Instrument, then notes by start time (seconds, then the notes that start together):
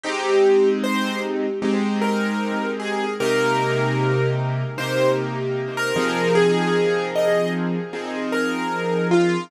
acoustic grand piano
0.03 G#3 C4 D#4 G4
0.84 C5
1.62 G#3 C4 D#4 G4
2.01 A#4
2.80 G#4
3.20 C3 A#3 D#4 G4 A#4
4.78 C3 A#3 D#4 G4 C5
5.77 A#4
5.96 F3 C4 D#4 G#4
6.35 G#4
7.15 D#5
7.93 F3 C4 D#4 G#4
8.32 A#4
9.11 F4